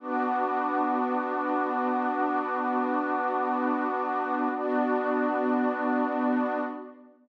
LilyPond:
<<
  \new Staff \with { instrumentName = "Pad 2 (warm)" } { \time 6/8 \key b \phrygian \tempo 4. = 53 <b d' fis'>2.~ | <b d' fis'>2. | <b d' fis'>2. | }
  \new Staff \with { instrumentName = "Pad 2 (warm)" } { \time 6/8 \key b \phrygian <b' fis'' d'''>2.~ | <b' fis'' d'''>2. | <b fis' d''>2. | }
>>